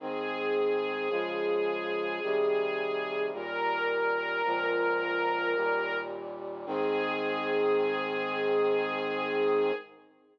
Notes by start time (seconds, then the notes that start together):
0.00 G#2 D#3 C4 G#4
1.10 C#3 F3 G#3
2.23 C3 D#3 G3
3.32 D#2 A#2 G3 A#4
4.45 C#2 A#2 F3
5.56 D#2 A#2 G3
6.66 G#2 D#3 C4 G#4